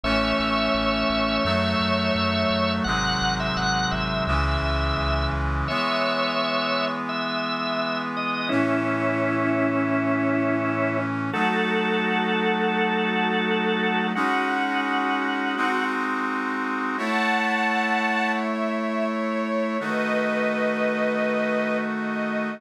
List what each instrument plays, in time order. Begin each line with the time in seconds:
0.04 synth bass 1 A1, brass section E3 A3 C#4, drawbar organ C#5 E5
0.39 synth bass 1 A1
0.74 synth bass 1 A1
1.10 synth bass 1 A1
1.45 synth bass 1 F#2, brass section D#3 F#3 A3
1.80 synth bass 1 F#2
2.15 synth bass 1 F#2
2.51 synth bass 1 F#2
2.84 synth bass 1 G#1, brass section C3 D#3 F#3 G#3, drawbar organ F#5
3.21 synth bass 1 G#1
3.40 drawbar organ E5
3.57 synth bass 1 G#1, drawbar organ F#5
3.91 synth bass 1 G#1, drawbar organ E5
4.27 synth bass 1 C#2, brass section C#3 E3 G#3, drawbar organ E5
4.63 synth bass 1 C#2
4.98 synth bass 1 C#2
5.33 synth bass 1 C#2
5.68 brass section E3 G#3 B3, drawbar organ C#5 E5
7.09 drawbar organ E5
8.17 drawbar organ D#5
8.49 brass section A2 E3 C#4, drawbar organ C#4 E4
11.33 brass section F#3 A3 D#4, drawbar organ F#4 A4
14.15 brass section G#3 C#4 D#4 F#4, drawbar organ F#4
14.50 drawbar organ F#4
15.57 brass section G#3 C4 D#4 F#4
16.98 brass section A3 E4 C#5, string ensemble 1 F#5 A5
18.39 string ensemble 1 E5
18.72 string ensemble 1 E5
19.10 string ensemble 1 C#5
19.80 brass section D#3 A3 F#4, string ensemble 1 B4 D#5
21.92 string ensemble 1 D#5